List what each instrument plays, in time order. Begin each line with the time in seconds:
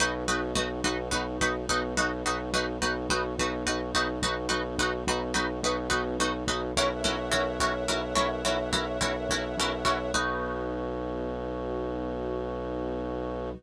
0.00 synth bass 2 B1, string ensemble 1 B3 D#4 F#4, pizzicato strings D#4 F#4 B4
0.28 synth bass 2 B1, pizzicato strings D#4 F#4 B4
0.55 synth bass 2 B1, pizzicato strings D#4 F#4 B4
0.84 synth bass 2 B1, pizzicato strings D#4 F#4 B4
1.11 synth bass 2 B1, pizzicato strings D#4 F#4 B4
1.41 synth bass 2 B1, pizzicato strings D#4 F#4 B4
1.69 synth bass 2 B1, pizzicato strings D#4 F#4 B4
1.97 synth bass 2 B1, pizzicato strings D#4 F#4 B4
2.25 synth bass 2 B1, pizzicato strings D#4 F#4 B4
2.53 synth bass 2 B1, pizzicato strings D#4 F#4 B4
2.82 synth bass 2 B1, pizzicato strings D#4 F#4 B4
3.10 synth bass 2 B1, pizzicato strings D#4 F#4 B4
3.39 synth bass 2 B1, pizzicato strings D#4 F#4 B4
3.66 synth bass 2 B1, pizzicato strings D#4 F#4 B4
3.94 synth bass 2 B1, pizzicato strings D#4 F#4 B4
4.22 synth bass 2 B1, pizzicato strings D#4 F#4 B4
4.49 synth bass 2 B1, pizzicato strings D#4 F#4 B4
4.79 synth bass 2 B1, pizzicato strings D#4 F#4 B4
5.07 synth bass 2 B1, pizzicato strings D#4 F#4 B4
5.34 synth bass 2 B1, pizzicato strings D#4 F#4 B4
5.63 synth bass 2 B1, pizzicato strings D#4 F#4 B4
5.90 synth bass 2 B1, pizzicato strings D#4 F#4 B4
6.19 synth bass 2 B1, pizzicato strings D#4 F#4 B4
6.48 synth bass 2 B1, pizzicato strings D#4 F#4 B4
6.76 synth bass 2 B1, pizzicato strings C#4 E4 F#4 A#4, string ensemble 1 A#4 C#5 E5 F#5
7.04 synth bass 2 B1, pizzicato strings C#4 E4 F#4 A#4
7.31 synth bass 2 B1, pizzicato strings C#4 E4 F#4 A#4
7.60 synth bass 2 B1, pizzicato strings C#4 E4 F#4 A#4
7.88 synth bass 2 B1, pizzicato strings C#4 E4 F#4 A#4
8.15 synth bass 2 B1, pizzicato strings C#4 E4 F#4 A#4
8.45 synth bass 2 B1, pizzicato strings C#4 E4 F#4 A#4
8.73 synth bass 2 B1, pizzicato strings C#4 E4 F#4 A#4
9.01 synth bass 2 B1, pizzicato strings C#4 E4 F#4 A#4
9.29 synth bass 2 B1, pizzicato strings C#4 E4 F#4 A#4
9.58 synth bass 2 B1, pizzicato strings C#4 E4 F#4 A#4
9.85 synth bass 2 B1, pizzicato strings C#4 E4 F#4 A#4
10.14 synth bass 2 B1, string ensemble 1 B3 D#4 F#4, pizzicato strings D#4 F#4 B4